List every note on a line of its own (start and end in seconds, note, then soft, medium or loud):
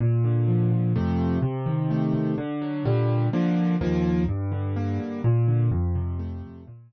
0.00 0.71 A#2 loud
0.24 0.92 D3 medium
0.48 0.93 F3 medium
0.72 0.94 A#2 medium
0.96 1.38 F2 loud
0.96 1.38 C3 loud
0.96 1.38 A3 loud
1.42 2.13 C3 loud
1.66 2.34 D#3 medium
1.90 2.36 A3 medium
2.14 2.36 C3 medium
2.38 2.83 D3 loud
2.62 2.84 F#3 loud
2.85 3.28 A#2 loud
2.85 3.28 D3 loud
2.85 3.28 G3 loud
3.33 3.76 D3 loud
3.33 3.76 F3 loud
3.33 3.76 A#3 loud
3.81 4.24 D#2 loud
3.81 4.24 F3 loud
3.81 4.24 A#3 loud
4.28 4.99 G2 loud
4.52 5.20 D3 medium
4.76 5.22 A#3 medium
4.99 5.22 G2 medium
5.24 5.69 A#2 loud
5.48 5.71 D3 medium
5.71 6.43 F2 loud
5.95 6.63 C3 loud
6.19 6.64 A3 loud
6.43 6.66 F2 medium
6.67 6.92 A#2 loud
6.91 6.92 D3 medium